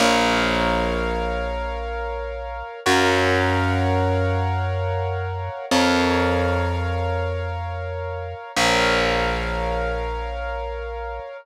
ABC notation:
X:1
M:5/4
L:1/8
Q:1/4=105
K:Bbm
V:1 name="Acoustic Grand Piano"
[Bdf]10 | [Bdfg]10 | [Bdf]10 | [Bdf]10 |]
V:2 name="Electric Bass (finger)" clef=bass
B,,,10 | G,,10 | F,,10 | B,,,10 |]